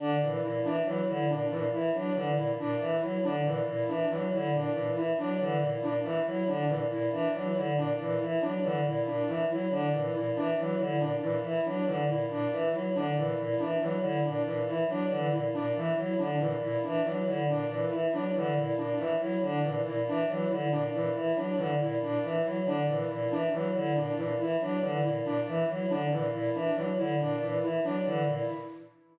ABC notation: X:1
M:6/8
L:1/8
Q:3/8=93
K:none
V:1 name="Choir Aahs" clef=bass
D, ^A,, A,, E, ^F, D, | ^A,, A,, E, ^F, D, A,, | ^A,, E, ^F, D, A,, A,, | E, ^F, D, ^A,, A,, E, |
^F, D, ^A,, A,, E, F, | D, ^A,, A,, E, ^F, D, | ^A,, A,, E, ^F, D, A,, | ^A,, E, ^F, D, A,, A,, |
E, ^F, D, ^A,, A,, E, | ^F, D, ^A,, A,, E, F, | D, ^A,, A,, E, ^F, D, | ^A,, A,, E, ^F, D, A,, |
^A,, E, ^F, D, A,, A,, | E, ^F, D, ^A,, A,, E, | ^F, D, ^A,, A,, E, F, | D, ^A,, A,, E, ^F, D, |
^A,, A,, E, ^F, D, A,, | ^A,, E, ^F, D, A,, A,, | E, ^F, D, ^A,, A,, E, | ^F, D, ^A,, A,, E, F, |
D, ^A,, A,, E, ^F, D, | ^A,, A,, E, ^F, D, A,, |]
V:2 name="Choir Aahs"
D E, E D E, E | D E, E D E, E | D E, E D E, E | D E, E D E, E |
D E, E D E, E | D E, E D E, E | D E, E D E, E | D E, E D E, E |
D E, E D E, E | D E, E D E, E | D E, E D E, E | D E, E D E, E |
D E, E D E, E | D E, E D E, E | D E, E D E, E | D E, E D E, E |
D E, E D E, E | D E, E D E, E | D E, E D E, E | D E, E D E, E |
D E, E D E, E | D E, E D E, E |]